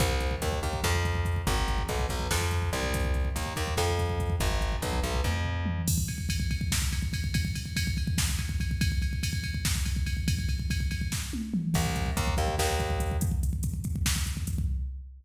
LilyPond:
<<
  \new Staff \with { instrumentName = "Electric Bass (finger)" } { \clef bass \time 7/8 \key c \minor \tempo 4 = 143 c,4 ees,8 ees,8 f,4. | aes,,4 b,,8 b,,8 f,4 c,8~ | c,4 ees,8 ees,8 f,4. | aes,,4 b,,8 b,,8 f,4. |
\key d \minor r2. r8 | r2. r8 | r2. r8 | r2. r8 |
\key c \minor c,4 ees,8 ees,8 ees,4. | r2. r8 | }
  \new DrumStaff \with { instrumentName = "Drums" } \drummode { \time 7/8 <hh bd>16 bd16 <hh bd>16 bd16 <hh bd>16 bd16 <hh bd>16 bd16 <bd sn>16 bd16 <hh bd>16 bd16 <hh bd>16 bd16 | <hh bd>16 bd16 <hh bd>16 bd16 <hh bd>16 bd16 <hh bd>16 bd16 <bd sn>16 bd16 <hh bd>16 bd16 <hh bd>16 bd16 | <hh bd>16 bd16 <hh bd>16 bd16 <hh bd>16 bd16 <hh bd>16 bd16 <bd sn>16 bd16 <hh bd>16 bd16 <hh bd>16 bd16 | <hh bd>16 bd16 <hh bd>16 bd16 <hh bd>16 bd16 <hh bd>16 bd16 <bd tommh>8 tomfh8 toml8 |
<cymc bd>16 bd16 <bd cymr>16 bd16 <bd cymr>16 bd16 <bd cymr>16 bd16 <bd sn>16 bd16 <bd cymr>16 bd16 <bd cymr>16 bd16 | <bd cymr>16 bd16 <bd cymr>16 bd16 <bd cymr>16 bd16 <bd cymr>16 bd16 <bd sn>16 bd16 <bd cymr>16 bd16 <bd cymr>16 bd16 | <bd cymr>16 bd16 <bd cymr>16 bd16 <bd cymr>16 bd16 <bd cymr>16 bd16 <bd sn>16 bd16 <bd cymr>16 bd16 <bd cymr>16 bd16 | <bd cymr>16 bd16 <bd cymr>16 bd16 <bd cymr>16 bd16 <bd cymr>16 bd16 <bd sn>8 tommh8 toml8 |
<cymc bd>16 bd16 <hh bd>16 bd16 <hh bd>16 bd16 <hh bd>16 bd16 <bd sn>16 bd16 <hh bd>16 bd16 <hh bd>16 bd16 | <hh bd>16 bd16 <hh bd>16 bd16 <hh bd>16 bd16 <hh bd>16 bd16 <bd sn>16 bd16 <hh bd>16 bd16 <hh bd>16 bd16 | }
>>